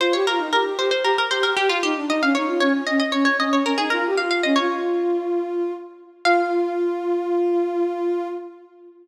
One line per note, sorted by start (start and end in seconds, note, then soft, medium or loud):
0.00 0.13 F4 medium
0.00 0.13 C5 medium
0.13 0.26 G4 medium
0.13 0.26 C#5 medium
0.27 0.39 F4 medium
0.27 0.49 A#4 medium
0.38 0.51 D#4 medium
0.53 0.64 G4 medium
0.53 0.65 A#4 medium
0.65 0.77 G4 medium
0.77 0.90 G4 medium
0.77 0.91 C5 medium
0.91 1.03 C5 medium
1.03 1.16 G4 medium
1.03 1.17 A#4 medium
1.18 1.31 A#4 medium
1.31 1.43 G4 medium
1.31 1.43 C5 medium
1.43 1.56 G4 medium
1.43 1.56 A#4 medium
1.56 1.68 G4 medium
1.56 1.69 G4 medium
1.68 1.81 F4 medium
1.68 1.82 F4 medium
1.82 1.94 D#4 medium
1.82 2.06 G4 medium
1.96 2.08 D4 medium
2.08 2.20 D#4 medium
2.08 2.22 D#5 medium
2.21 2.33 C#4 medium
2.21 2.35 F5 medium
2.35 2.48 D#4 medium
2.35 2.59 C#5 medium
2.46 2.59 F4 medium
2.60 2.72 C#4 medium
2.60 2.73 C#5 medium
2.73 2.85 C#4 medium
2.87 2.99 C#4 medium
2.87 2.99 D#5 medium
3.00 3.12 D#5 medium
3.12 3.26 C#4 medium
3.12 3.24 C#5 medium
3.25 3.37 C#5 medium
3.39 3.50 C#4 medium
3.39 3.52 D#5 medium
3.50 3.63 C#4 medium
3.50 3.65 C#5 medium
3.64 3.76 C#4 medium
3.64 3.78 A#4 medium
3.77 3.90 D#4 medium
3.77 3.90 G#4 medium
3.90 4.04 F4 medium
3.90 4.11 A#4 medium
4.06 4.18 G4 medium
4.17 4.41 F4 medium
4.17 4.30 F5 medium
4.31 4.43 F5 medium
4.43 4.57 C#4 medium
4.43 4.56 D#5 medium
4.56 5.71 F4 medium
4.56 5.67 C#5 medium
6.25 8.27 F4 loud
6.25 8.27 F5 loud